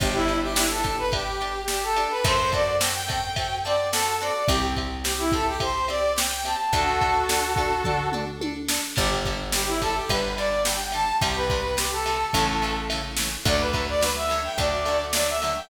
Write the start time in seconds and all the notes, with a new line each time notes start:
0.00 G1 D4 G4, kick, ride
0.14 E4
0.28 D4 G4, ride
0.42 G4
0.56 D4 E4 G4, snare
0.70 A4
0.84 D4 G4, kick, ride
0.98 B4
1.12 D4 G4, kick, ride
1.41 D4 G4, ride
1.68 D4 G4, snare
1.83 A4
1.96 D4 G4, ride
2.10 B4
2.24 F#2 C4 F#4 A4 C5, kick, ride
2.52 C4 F#4 A4 D5, kick, ride
2.80 C4 F#4 A4 G5, snare
2.94 G5
3.08 C4 F#4 A4, kick, ride
3.36 C4 F#4 A4, kick, ride
3.64 C4 F#4 A4 D5, ride
3.92 C4 F#4 A4, snare
4.21 C4 F#4 A4 D5
4.48 C2 C4 G4, kick, ride
4.76 C4 G4, kick, ride
5.04 C4 G4, snare
5.19 E4
5.32 C4 G4 A4, kick, ride
5.47 G4
5.60 C4 G4 C5, kick, ride
5.88 C4 G4 D5, ride
6.16 C4 G4 G5, snare
6.45 C4 G4 A5, ride
6.73 D2 D4 F#4 A4, kick, ride
7.01 D4 A4, kick, ride
7.29 D4 A4, snare
7.56 D4 A4, kick, ride
7.84 D4 A4, kick, floor tom
8.12 D4 A4, mid tom
8.41 D4 A4, high tom
8.68 D4 A4, snare
8.96 G1 D3 G3 G4, kick, crash
9.25 D3 G3, kick, ride
9.52 D3 G3 G4, snare
9.67 E4
9.81 D3 G3 A4, kick, ride
9.95 G4
10.09 G1 D3 G3 B4, kick, ride
10.37 D3 G3 D5, ride
10.65 D3 G3 G5, snare
10.92 D3 G3 A5, ride
11.21 C2 C3 G3 G4, kick, ride
11.36 B4
11.50 C3 G3, kick, ride
11.77 C3 G3 G4, snare
11.92 A4
12.06 C3 G3, ride
12.33 A1 C#3 E3 A3, kick, ride
12.62 C#3 E3 A3, ride
12.90 C#3 E3 A3, ride
13.17 C#3 E3 A3, snare
13.45 D2 D3 F#3 A3 D5, kick, ride
13.60 B4
13.73 D3 F#3 A3, kick, ride
13.88 D5
14.01 D3 F#3 A3 B4, snare
14.16 E5
14.29 D3 F#3 A3, ride
14.44 G5
14.58 D2 D3 F#3 A3 D5, kick, ride
14.85 D3 F#3 A3, ride
15.13 D3 F#3 A3 D5, snare
15.28 E5
15.42 D3 F#3 A3, ride
15.56 G5